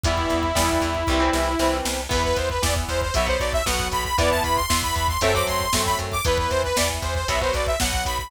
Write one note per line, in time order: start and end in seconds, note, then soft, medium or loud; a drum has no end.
0.04 0.26 E2 medium
0.04 0.47 E3 loud
0.04 0.47 G3 loud
0.04 0.47 B3 loud
0.04 1.77 E4 loud
0.04 kick loud
0.04 closed hi-hat loud
0.18 kick medium
0.30 0.52 E2 medium
0.30 kick medium
0.30 closed hi-hat medium
0.43 kick medium
0.55 0.78 E2 medium
0.55 0.97 E3 medium
0.55 0.97 G3 loud
0.55 0.97 B3 loud
0.55 kick medium
0.55 snare loud
0.69 kick medium
0.82 1.04 E2 medium
0.82 kick medium
0.82 closed hi-hat medium
0.95 kick medium
1.07 1.30 C2 loud
1.07 1.20 E3 loud
1.07 1.20 G3 loud
1.07 1.20 C4 loud
1.07 kick medium
1.20 1.51 E3 loud
1.20 1.51 G3 medium
1.20 1.51 C4 loud
1.33 1.55 C2 medium
1.33 snare medium
1.59 1.81 C2 medium
1.59 2.01 E3 medium
1.59 2.01 G3 medium
1.59 2.01 C4 loud
1.59 snare medium
1.85 2.07 C2 medium
1.85 snare loud
2.09 2.33 E2 medium
2.09 2.51 E3 loud
2.09 2.51 B3 loud
2.09 2.23 B4 loud
2.09 kick loud
2.09 crash loud
2.24 2.37 B4 loud
2.24 kick medium
2.36 2.59 E2 medium
2.36 2.49 C5 medium
2.36 kick medium
2.36 closed hi-hat medium
2.50 2.62 B4 medium
2.50 kick medium
2.62 2.85 E2 medium
2.62 3.04 E3 medium
2.62 3.04 B3 medium
2.62 2.75 D5 medium
2.62 kick medium
2.62 snare loud
2.76 kick medium
2.89 3.11 E2 medium
2.89 3.01 C5 medium
2.89 kick medium
2.89 closed hi-hat medium
3.02 3.14 C5 medium
3.02 kick medium
3.14 3.37 B1 medium
3.14 3.26 F#3 loud
3.14 3.26 B3 loud
3.14 3.27 E5 medium
3.14 kick medium
3.14 closed hi-hat loud
3.27 3.58 F#3 medium
3.27 3.58 B3 loud
3.27 3.40 C5 medium
3.27 kick medium
3.40 3.62 B1 medium
3.40 3.52 D5 medium
3.40 kick medium
3.40 closed hi-hat medium
3.53 3.65 E5 loud
3.53 kick medium
3.66 3.88 B1 medium
3.66 4.08 F#3 loud
3.66 4.08 B3 loud
3.66 3.88 F#5 medium
3.66 kick medium
3.66 snare loud
3.80 kick medium
3.92 4.14 B1 medium
3.92 4.04 B5 medium
3.92 kick medium
3.92 closed hi-hat medium
4.05 4.17 B5 medium
4.05 kick medium
4.18 4.40 E2 medium
4.18 4.60 E3 loud
4.18 4.60 B3 loud
4.18 4.30 D5 loud
4.18 kick loud
4.18 closed hi-hat loud
4.31 4.43 A5 medium
4.31 kick medium
4.44 4.66 E2 medium
4.44 4.56 B5 medium
4.44 kick medium
4.44 closed hi-hat medium
4.56 4.81 C6 medium
4.56 kick medium
4.70 4.92 E2 medium
4.70 5.11 E3 loud
4.70 5.11 B3 medium
4.70 kick medium
4.70 snare loud
4.83 4.95 B5 medium
4.83 kick medium
4.95 5.18 E2 medium
4.95 5.08 B5 medium
4.95 kick medium
4.95 closed hi-hat medium
5.08 5.21 C6 medium
5.08 kick medium
5.21 5.43 F#2 loud
5.21 5.33 F#3 loud
5.21 5.33 A3 loud
5.21 5.33 C4 loud
5.21 5.34 E5 loud
5.21 kick medium
5.21 closed hi-hat loud
5.34 5.66 F#3 loud
5.34 5.66 A3 medium
5.34 5.66 C4 loud
5.34 5.47 D6 medium
5.34 kick medium
5.47 5.69 F#2 medium
5.47 5.81 C6 medium
5.47 kick medium
5.47 closed hi-hat medium
5.61 kick medium
5.73 5.95 F#2 medium
5.73 6.16 F#3 medium
5.73 6.16 A3 medium
5.73 6.16 C4 medium
5.73 kick medium
5.73 snare loud
5.86 5.98 B5 medium
5.86 kick medium
5.99 6.21 F#2 medium
5.99 kick medium
5.99 closed hi-hat medium
6.12 6.24 D6 medium
6.12 kick medium
6.25 6.47 E2 medium
6.25 6.67 E3 loud
6.25 6.67 B3 loud
6.25 6.38 B4 loud
6.25 kick loud
6.25 closed hi-hat loud
6.38 6.51 B4 medium
6.38 kick medium
6.50 6.73 E2 medium
6.50 6.63 C5 loud
6.50 kick medium
6.50 closed hi-hat medium
6.64 6.76 B4 loud
6.64 kick medium
6.76 6.99 E2 medium
6.76 7.18 E3 medium
6.76 7.18 B3 loud
6.76 6.89 D5 medium
6.76 kick medium
6.76 snare loud
6.90 kick medium
7.02 7.24 E2 medium
7.02 7.15 C5 medium
7.02 kick medium
7.02 closed hi-hat medium
7.15 7.28 C5 medium
7.15 kick medium
7.28 7.50 B1 medium
7.28 7.39 F#3 loud
7.28 7.39 B3 loud
7.28 7.41 E5 medium
7.28 kick medium
7.28 closed hi-hat loud
7.41 7.72 F#3 loud
7.41 7.72 B3 medium
7.41 7.54 C5 medium
7.41 kick medium
7.54 7.76 B1 medium
7.54 7.67 D5 medium
7.54 kick medium
7.54 closed hi-hat medium
7.67 7.79 E5 medium
7.67 kick medium
7.80 8.02 B1 medium
7.80 8.23 F#3 medium
7.80 8.23 B3 loud
7.80 8.04 F#5 loud
7.80 kick medium
7.80 snare loud
7.93 kick medium
8.05 8.28 B1 medium
8.05 8.18 B5 medium
8.05 kick medium
8.05 closed hi-hat medium
8.19 8.31 B5 medium
8.19 kick medium